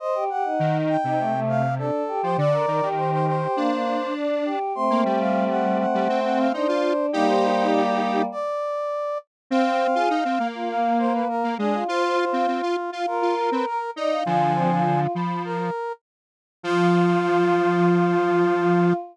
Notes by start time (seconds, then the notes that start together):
0.00 C5 D#5
0.15 G4
0.30 G4 F#5
0.45 D#4
0.59 D#3
0.89 G5
1.04 C3 D#4
1.19 A3
1.34 A3
1.49 F5
1.78 D4 A4
2.08 G4
2.23 F3 C5
2.37 D3 D5
2.52 A#4
2.67 D#3 A#4
2.82 D#3 G4
2.97 C5
3.12 C5
3.27 C5
3.42 G4
3.56 A#3 D4
3.71 A#3
4.16 D4
4.45 G4
4.75 A3 C4 C6
4.90 A#3
5.05 G3 G5
5.20 F5
5.50 F#5
5.79 F#5
5.94 G3
6.09 C4
6.24 F#5
6.39 F5
6.53 D4 D#4 C5
6.68 F4
7.13 G3 A#3 D#4 G4
7.28 C5
7.72 D5
8.32 D5
9.50 C4 F5
9.65 C4
9.80 C4
9.95 F4 G#4
10.10 D#4
10.25 C4
10.40 A#3
10.54 F4
10.69 A#3 F5
10.99 C5
11.14 B4
11.29 A#4
11.44 A#3
11.58 G#3 D4 G#4
11.73 F4
11.88 F4 C5
12.03 C5
12.18 C5
12.33 C4 F5
12.48 C4
12.62 F4
12.92 F4 F5
13.07 F4 A#4
13.22 F4
13.37 A#4
13.51 C4 B4
13.66 A#4
13.96 D#4 D5 D#5
14.11 F5
14.26 D3 F3 F4 G#5
14.55 C4
14.70 F4
15.15 F3 B5
15.45 A#4
16.63 F3 F4